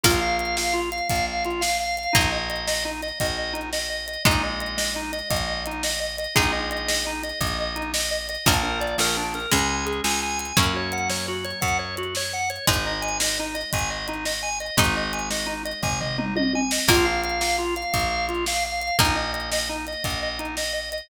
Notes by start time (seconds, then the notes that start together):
0.04 A#1 A#3 F4, kick, crash
0.21 F5
0.39 F5, closed hi-hat
0.57 F5, snare
0.73 F4
0.92 F5, closed hi-hat
1.09 A#1 F5, kick, closed hi-hat
1.27 F5
1.45 F4, closed hi-hat
1.61 F5, snare
1.80 F5
1.97 F5, closed hi-hat
2.13 A#1 A#3 D#4, kick, closed hi-hat
2.32 D#5
2.50 D#5, closed hi-hat
2.67 D#5, snare
2.85 D#4
3.02 D#5, closed hi-hat
3.20 A#1 D#5, kick, closed hi-hat
3.37 D#5
3.53 D#4, closed hi-hat
3.73 D#5, snare
3.90 D#5
4.07 D#5, closed hi-hat
4.25 A#1 G#3 D#4, kick, closed hi-hat
4.43 D#5
4.60 D#5, closed hi-hat
4.77 D#5, snare
4.96 D#4
5.13 D#5, closed hi-hat
5.30 A#1 D#5, kick, closed hi-hat
5.47 D#5
5.66 D#4, closed hi-hat
5.83 D#5, snare
6.00 D#5
6.18 D#5, closed hi-hat
6.35 A#1 G#3 D#4, kick, closed hi-hat
6.52 D#5
6.71 D#5, closed hi-hat
6.88 D#5, snare
7.06 D#4
7.23 D#5, closed hi-hat
7.40 A#1 D#5, kick, closed hi-hat
7.60 D#5
7.76 D#4, closed hi-hat
7.94 D#5, snare
8.11 D#5
8.29 D#5, closed hi-hat
8.46 A#1 F3 A#3 D4, kick, crash
8.63 A#4
8.81 D5, closed hi-hat
8.98 A#1 A#4, snare
9.17 D4
9.34 A#4, closed hi-hat
9.51 C#2 G#3 C#4 G#5, kick, closed hi-hat
9.69 G#5
9.86 G#4, closed hi-hat
10.04 C#2 G#5, snare
10.23 G#5
10.39 G#5, closed hi-hat
10.57 F#2 F#3 A#3 C#4 F#4, kick, closed hi-hat
10.76 C#5
10.92 F#5, closed hi-hat
11.10 C#5, snare
11.28 F#4
11.45 C#5, closed hi-hat
11.61 F#2 F#5, kick, closed hi-hat
11.79 C#5
11.97 F#4, closed hi-hat
12.15 C#5, snare
12.33 F#5
12.50 C#5, closed hi-hat
12.67 G#1 G#3 D#4, kick, closed hi-hat
12.86 D#5
13.02 G#5, closed hi-hat
13.20 D#5, snare
13.39 D#4
13.55 D#5, closed hi-hat
13.73 G#1 G#5, kick, closed hi-hat
13.90 D#5
14.08 D#4, closed hi-hat
14.25 D#5, snare
14.43 G#5
14.60 D#5, closed hi-hat
14.77 G#1 G#3 D#4, kick, closed hi-hat
14.96 D#5
15.13 G#5, closed hi-hat
15.31 D#5, snare
15.46 D#4
15.65 D#5, closed hi-hat
15.83 G#1 G#5, kick, floor tom
16.01 D#5, floor tom
16.18 D#4, mid tom
16.36 D#5, high tom
16.53 G#5, high tom
16.71 D#5, snare
16.88 A#1 A#3 F4, kick, crash
17.05 F5
17.24 F5, closed hi-hat
17.40 F5, snare
17.58 F4
17.76 F5, closed hi-hat
17.93 A#1 F5, kick, closed hi-hat
18.10 F5
18.29 F4, closed hi-hat
18.46 F5, snare
18.65 F5
18.80 F5, closed hi-hat
18.99 A#1 A#3 D#4, kick, closed hi-hat
19.16 D#5
19.33 D#5, closed hi-hat
19.52 D#5, snare
19.69 D#4
19.87 D#5, closed hi-hat
20.04 A#1 D#5, kick, closed hi-hat
20.23 D#5
20.39 D#4, closed hi-hat
20.57 D#5, snare
20.73 D#5
20.92 D#5, closed hi-hat